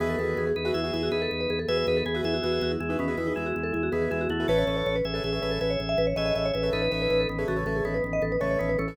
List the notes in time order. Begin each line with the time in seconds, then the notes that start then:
0.00 E2 D#3 B3 F#4 G#4 B4 E5
0.09 A4
0.19 E2 F#4 G#4 A4 B4 E5
0.28 A4
0.37 E2 G#4
0.47 G#4
0.56 E2 D#4 B4
0.65 F#4 G#4 B4 E5
0.74 E2 E4 G#4 E5
0.84 F#4 G#4 B4 E5
0.93 E2 E4 F#4 G#4 B4 E5
1.03 F#4
1.12 E2 D#4 G#4 B4
1.22 A4
1.31 E2
1.40 B4
1.50 E2 G#4
1.59 A4
1.68 E2 F#4 G#4 B4 E5
1.77 B4
1.87 E2 D#4 B4
1.97 A4
2.06 E2 B3 G#4
2.14 F#4 G#4 B4 E5
2.24 E2 E4 G#4 E5
2.34 F#4
2.43 E2 F#4 G#4 B4 E5
2.52 F#4
2.61 E2 F#4
2.71 E4
2.80 E2 G#3 E4
2.89 D#4 F#4 G#4 B4 E5
2.99 E2 D#3 B3 C#4
3.08 F#4 G#4 B4 E5
3.17 E2 E4 F#4 G#4 B4 E5
3.27 D#4
3.36 E2 G#3 E4
3.46 F#4
3.56 E2
3.63 A4
3.73 E2 E4
3.83 F#4
3.92 E2 D#3 B3 F#4 G#4 B4 E5
4.02 G#4
4.11 E2 G#3 E4 G#4
4.21 F#4
4.30 E2 A3 E4 F#4
4.40 E4 F#4 G#4 B4 E5
4.48 A1 C#4 A4 B4 C#5 E5
4.58 C#5
4.67 A1 A4 B4 C#5 E5
4.77 C#5
4.86 A1 C#5
4.96 B4
5.05 A1 G#4 E5
5.14 A4 B4 C#5 E5
5.24 A1 G#4 E5
5.33 A4 B4 C#5 E5
5.42 A1 A4 B4 C#5 E5
5.51 A4
5.61 A1 G#4 B4 E5
5.70 C#5
5.80 A1
5.89 E5
5.98 A1 B4
6.07 C#5
6.16 A1 G#4 A4 B4 C#5 D#5 E5
6.26 D#5
6.35 A1 G#4 D#5 E5
6.45 C#5
6.53 A1 G#4 B4 E5
6.63 A4 B4 C#5 E5
6.73 A1 D#4 A4 B4
6.82 B4
6.91 A1 A4 B4 C#5 E5
7.02 B4
7.10 A1 B4
7.20 A4
7.29 A1 D#3 B3
7.39 G#4 A4 B4 C#5 E5
7.48 A1 C#3 A3 F#4
7.56 A4 B4 C#5 E5
7.66 A1 A4 B4 C#5 E5
7.76 G#4
7.85 A1 D#3 B3 A4
7.94 B4
8.04 A1
8.13 D#5
8.22 A1 A4
8.32 B4
8.40 A1 C#3 A3 A4 B4 C#5 E5
8.51 C#5
8.59 A1 D#3 B3 C#5
8.69 B4
8.79 A1 E3 C#4 A4
8.88 A4 B4 C#5 E5